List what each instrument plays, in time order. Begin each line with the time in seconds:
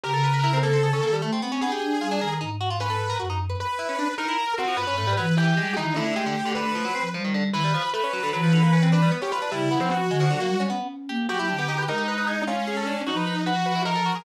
0.04 flute C#3, pizzicato strings G4, lead 2 (sawtooth) A#4
0.14 pizzicato strings A4
0.24 pizzicato strings B4
0.34 pizzicato strings B4
0.44 pizzicato strings E4
0.53 pizzicato strings C4
0.63 pizzicato strings A#3, lead 2 (sawtooth) A4
0.73 pizzicato strings C4
0.83 pizzicato strings G#4
0.93 pizzicato strings C#4
1.03 flute D#3, pizzicato strings A#3
1.13 pizzicato strings G3
1.22 pizzicato strings A3, flute A3
1.33 pizzicato strings C4
1.42 pizzicato strings B3, flute C4
1.52 pizzicato strings C#4
1.60 pizzicato strings B3, flute D4, lead 2 (sawtooth) G#4
1.72 pizzicato strings G4
1.82 flute D4
2.01 flute G3, pizzicato strings F4
2.11 pizzicato strings D4
2.21 flute D#3, pizzicato strings A#4
2.41 flute G#2, pizzicato strings D#4
2.61 pizzicato strings F#4
2.70 pizzicato strings F4
2.80 pizzicato strings C#4, lead 2 (sawtooth) B4
2.90 pizzicato strings A4
3.10 pizzicato strings A#4
3.20 flute F#2, pizzicato strings F#4
3.30 pizzicato strings D#4
3.50 pizzicato strings B4
3.60 lead 2 (sawtooth) B4
3.79 pizzicato strings E4
3.89 pizzicato strings C#4
3.99 pizzicato strings D4
4.18 pizzicato strings D#4, lead 2 (sawtooth) A#4
4.28 pizzicato strings E4
4.58 pizzicato strings C4, lead 2 (sawtooth) F#4
4.68 pizzicato strings F3
4.77 flute G2, pizzicato strings B3, lead 2 (sawtooth) B4
4.87 pizzicato strings C#4
4.97 flute G#2, pizzicato strings A3
5.07 pizzicato strings G3
5.17 flute E3, pizzicato strings F#3, lead 2 (sawtooth) B4
5.37 pizzicato strings E3, lead 2 (sawtooth) G4
5.57 flute G3, pizzicato strings G#3
5.76 flute D#3, pizzicato strings E3, lead 2 (sawtooth) D#4
5.95 pizzicato strings D3, flute A3, lead 2 (sawtooth) E4
6.06 pizzicato strings D3
6.16 pizzicato strings G#3, lead 2 (sawtooth) G4
6.26 pizzicato strings D3
6.45 pizzicato strings D3
6.55 pizzicato strings D3, lead 2 (sawtooth) B4
6.65 pizzicato strings D3
6.75 pizzicato strings F3
6.85 pizzicato strings F#3
6.95 flute F3, pizzicato strings C4
7.14 pizzicato strings F3, flute G3
7.24 pizzicato strings D#3
7.34 pizzicato strings D3
7.52 flute D#3, pizzicato strings E3, lead 2 (sawtooth) B4
7.64 pizzicato strings G3
7.74 pizzicato strings F3
7.93 pizzicato strings A3, lead 2 (sawtooth) B4
8.04 pizzicato strings C#4
8.13 pizzicato strings F#3
8.23 pizzicato strings D3
8.33 flute E3, pizzicato strings F#3, lead 2 (sawtooth) B4
8.43 pizzicato strings F3
8.53 pizzicato strings D3
8.63 pizzicato strings A#3
8.73 pizzicato strings C#4
8.83 pizzicato strings C4
8.92 pizzicato strings D4, lead 2 (sawtooth) B4
9.02 pizzicato strings G3
9.12 pizzicato strings B3
9.22 pizzicato strings C#4, lead 2 (sawtooth) G4
9.32 pizzicato strings F4, lead 2 (sawtooth) B4
9.42 pizzicato strings D4
9.52 flute C#3, pizzicato strings G3, lead 2 (sawtooth) E4
9.71 flute F3, pizzicato strings B3
9.80 lead 2 (sawtooth) C4
9.91 lead 2 (sawtooth) F#4
10.09 flute D3, pizzicato strings G#3
10.20 pizzicato strings F3
10.30 pizzicato strings D3, flute F#3
10.40 pizzicato strings A#3
10.48 flute G3
10.60 pizzicato strings C#4
10.70 pizzicato strings B3, flute C#4
11.09 flute A#3, pizzicato strings G4
11.29 flute F#3, pizzicato strings F#4, lead 2 (sawtooth) G4
11.39 pizzicato strings E4
11.49 flute D3, pizzicato strings D4
11.59 pizzicato strings B3
11.68 pizzicato strings D#4
11.78 pizzicato strings B4
11.88 flute G#3, lead 2 (sawtooth) D#4, pizzicato strings A#4
11.98 pizzicato strings G4
12.08 pizzicato strings B4
12.18 pizzicato strings B4
12.27 pizzicato strings G#4
12.47 lead 2 (sawtooth) C#4, pizzicato strings F4
12.67 pizzicato strings G#4
12.77 pizzicato strings A4
12.87 pizzicato strings D4
13.07 flute F3, lead 2 (sawtooth) D#4, pizzicato strings F#4
13.17 pizzicato strings B4
13.27 pizzicato strings B4
13.46 lead 2 (sawtooth) F#4, pizzicato strings B4
13.66 pizzicato strings B4
13.75 pizzicato strings E4
13.85 pizzicato strings D#4, lead 2 (sawtooth) A#4
13.95 pizzicato strings A4
14.06 pizzicato strings F#4
14.15 pizzicato strings G#4